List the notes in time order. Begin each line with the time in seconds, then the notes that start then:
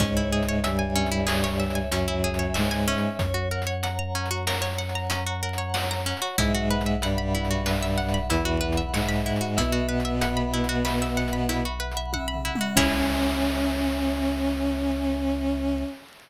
0.00 C#2 G#2 G#3 C#4 C#5, kick, closed hi-hat
0.17 E4
0.32 G#4 E5
0.43 closed hi-hat
0.49 C#5
0.64 G2 G3 E5 G#5, closed hi-hat
0.79 G#5
0.95 C#4 E5
1.06 closed hi-hat
1.12 E4
1.27 G#4 C#5, snare
1.44 C#5
1.59 E5
1.70 closed hi-hat
1.75 G#5
1.91 F#2 F#3 C#4 G#5, closed hi-hat
2.08 E4
2.24 G#4 E5
2.34 closed hi-hat
2.39 C#5
2.54 G#2 G#3 C#5 E5, snare
2.71 G#5
2.88 C#4 E5
2.98 closed hi-hat
3.19 F#2 C#5, kick, closed hi-hat
3.34 F#4
3.51 A#4 F#5
3.62 closed hi-hat
3.67 C#5
3.83 F#5 A#5, closed hi-hat
3.99 A#5
4.15 C#4 F#5
4.26 closed hi-hat
4.31 F#4
4.47 A#4 C#5, snare
4.62 C#5
4.78 F#5
4.89 closed hi-hat
4.95 A#5
5.10 C#4 A#5, closed hi-hat
5.26 F#4
5.43 A#4 F#5
5.53 closed hi-hat
5.58 C#5
5.74 C#5 F#5, snare
5.91 A#5
6.06 C#4 F#5
6.17 closed hi-hat
6.22 F#4
6.38 B1 G#2 G#3 E4 E5, kick, closed hi-hat
6.55 F#4
6.70 B4 F#5
6.81 closed hi-hat
6.86 E5
7.02 G2 G3 F#5 B5, closed hi-hat
7.18 B5
7.35 E4 F#5
7.45 closed hi-hat
7.51 F#4
7.66 B4 E5, snare
7.83 E5
7.98 F#5
8.09 closed hi-hat
8.14 B5
8.29 E2 E3 E4 B5, closed hi-hat
8.45 F#4
8.61 B4 F#5
8.72 closed hi-hat
8.77 E5
8.93 G#2 G#3 E5 F#5, snare
9.09 B5
9.26 E4 F#5
9.36 closed hi-hat
9.41 F#4
9.57 B1 B2 B3 E4 E5, kick, closed hi-hat
9.72 F#4
9.89 B4 F#5
10.00 closed hi-hat
10.05 E5
10.21 F#5 B5, closed hi-hat
10.37 B5
10.53 E4 F#5
10.64 closed hi-hat
10.69 F#4
10.85 B4 E5, snare
11.02 E5
11.17 F#5
11.28 closed hi-hat
11.33 B5
11.49 E4 B5, closed hi-hat
11.65 F#4
11.80 B4 F#5
11.91 closed hi-hat
11.97 E5
12.13 E5 F#5, kick, high tom
12.28 B5
12.34 floor tom
12.45 E4 F#5
12.55 mid tom
12.61 F#4
12.75 C#2 C#4 E4 G#4 C#5 E5 G#5, kick, crash